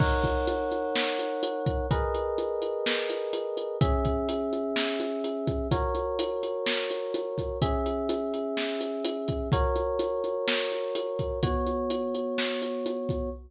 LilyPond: <<
  \new Staff \with { instrumentName = "Electric Piano 1" } { \time 4/4 \key b \major \tempo 4 = 126 <dis' ais' cis'' fis''>1 | <gis' ais' b' dis''>1 | <cis' gis' e''>1 | <fis' ais' cis''>1 |
<cis' gis' e''>1 | <fis' ais' cis''>1 | <b fis' cis''>1 | }
  \new DrumStaff \with { instrumentName = "Drums" } \drummode { \time 4/4 <cymc bd>8 <hh bd>8 hh8 hh8 sn8 hh8 hh8 <hh bd>8 | <hh bd>8 hh8 hh8 hh8 sn8 hh8 hh8 hh8 | <hh bd>8 <hh bd>8 hh8 hh8 sn8 hh8 hh8 <hh bd>8 | <hh bd>8 hh8 hh8 hh8 sn8 hh8 hh8 <hh bd>8 |
<hh bd>8 hh8 hh8 hh8 sn8 hh8 hh8 <hh bd>8 | <hh bd>8 hh8 hh8 hh8 sn8 hh8 hh8 <hh bd>8 | <hh bd>8 hh8 hh8 hh8 sn8 hh8 hh8 <hh bd>8 | }
>>